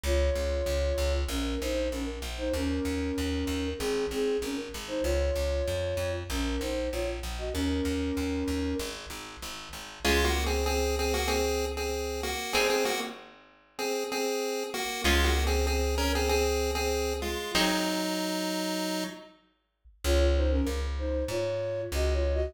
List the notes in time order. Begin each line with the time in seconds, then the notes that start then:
0.04 C#2 F4 C#5
0.35 C#2
0.66 C#2
0.98 C#2
1.29 A#1 C#4 A#4
1.61 A#1 D#4 C5
1.92 A#1 C#4 A#4
2.22 A#1
2.38 D#4 C5
2.54 D#2 C#4 A#4
2.85 D#2
3.18 D#2
3.47 D#2
3.78 G#1 C4 G#4
4.11 G#1 C4 G#4
4.42 G#1 C#4 A#4
4.74 G#1
4.88 D#4 C5
5.03 C#2 F4 C#5
5.36 C#2
5.68 F2
5.97 F2
6.30 A#1 C#4 A#4
6.60 A#1 D#4 C5
6.92 A#1 F4 C#5
7.23 A#1
7.38 F#4 D#5
7.53 D#2 C#4 A#4
7.85 D#2
8.17 D#2
8.48 D#2
8.79 G#1
9.10 G#1
9.42 G#1
9.73 G#1
10.05 C#2 G#3 C#4 F4 G#4
10.24 A#3 F#4
10.46 C4 G#4
10.66 C4 G#4
10.99 C4 G#4
11.14 A#3 F#4
11.28 C4 G#4
11.77 C4 G#4
12.23 A#3 F#4
12.53 G#1 C4 D#4 G#4
12.70 C4 G#4
12.85 A#3 F#4
13.79 C4 G#4
14.12 C4 G#4
14.74 A#3 F#4
15.04 C#2 G#3 C#4 F4 G#4
15.24 A#3 F#4
15.47 C4 G#4
15.67 C4 G#4
15.98 C#4 A#4
16.15 C4 G#4
16.29 C4 G#4
16.75 C4 G#4
17.22 G#3 F4
17.55 G#1 F#3 C4 D#4 G#4
20.04 C#2 F4 C#5
20.20 F4 C#5
20.37 D#4 C5
20.51 C#4 A#4
20.67 C#2
20.99 D#4 C5
21.28 G#2 F4 C#5
21.92 C#2 F#4 D#5
22.13 F4 C#5
22.34 F#4 D#5